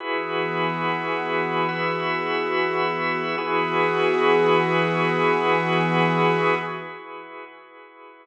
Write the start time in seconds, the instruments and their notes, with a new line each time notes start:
0.00 pad 5 (bowed) E3 B3 F#4 G#4, drawbar organ E4 F#4 G#4 B4
1.68 drawbar organ E4 F#4 B4 E5
3.38 pad 5 (bowed) E3 B3 F#4 G#4, drawbar organ E4 F#4 G#4 B4